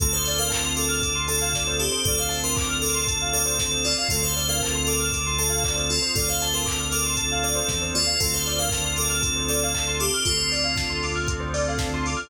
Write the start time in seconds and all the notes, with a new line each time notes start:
0.00 D2 C4 D4 F4 A4, kick, closed hi-hat
0.13 C5
0.25 D5, open hi-hat
0.38 A#4 F5
0.50 A5, kick, clap
0.65 C6
0.76 A4 D6, open hi-hat
0.89 F6
1.02 D6, kick, closed hi-hat
1.15 C6
1.28 A4 A5, open hi-hat
1.42 F5
1.53 D5, kick, snare
1.67 C5
1.79 G4 A4, open hi-hat
1.92 C5
2.04 D2 C4 D4 F4 A4 D5, kick, closed hi-hat
2.18 C5 F5
2.29 A5, open hi-hat
2.44 A#4 C6
2.56 D6, kick, clap
2.69 F6
2.82 A4 D6, open hi-hat
2.94 C6
3.07 A5, kick, closed hi-hat
3.22 F5
3.33 A4 D5, open hi-hat
3.46 C5
3.58 A4, kick, snare
3.71 C5
3.84 F4 D5, open hi-hat
3.98 F5
4.09 D2 C4 D4 F4 A4, kick, closed hi-hat
4.22 C5
4.36 D5, open hi-hat
4.49 A#4 F5
4.61 A5, kick, clap
4.75 C6
4.86 A4 D6, open hi-hat
5.00 F6
5.12 D6, kick, closed hi-hat
5.26 C6
5.38 A4 A5, open hi-hat
5.50 F5
5.64 D5, kick, clap
5.75 C5
5.90 F4 A4, open hi-hat
6.02 C5
6.15 D2 C4 D4 F4 A4 D5, kick, closed hi-hat
6.28 C5 F5
6.40 A5, open hi-hat
6.54 A#4 C6
6.66 D6, kick, clap
6.80 F6
6.92 A4 D6, open hi-hat
7.06 C6
7.17 A5, kick, closed hi-hat
7.32 F5
7.43 A4 D5, open hi-hat
7.55 C5
7.68 E2 A4, kick, snare
7.82 C5
7.94 D#2 F4 D5, open hi-hat
8.07 F5
8.20 D2 C4 D4 F4 A4, kick, closed hi-hat
8.34 C5
8.46 D5, open hi-hat
8.59 A#4 F5
8.70 A5, kick, snare
8.84 C6
8.96 A4 D6, open hi-hat
9.10 F6
9.21 A4, kick, closed hi-hat
9.36 C5
9.48 A4 D5, open hi-hat
9.63 F5
9.74 A5, kick, clap
9.87 C6
10.00 G4 D6, open hi-hat
10.14 F6
10.25 D2 C4 D4 F4 A4, kick, closed hi-hat
10.38 C5
10.52 D5, open hi-hat
10.64 F5
10.76 A5, kick, snare
10.90 C6
11.03 D6, open hi-hat
11.16 F6
11.28 A4, kick, closed hi-hat
11.40 C5
11.54 D5, open hi-hat
11.68 F5
11.78 A5, kick, snare
11.94 C6
12.06 D6, open hi-hat
12.17 F6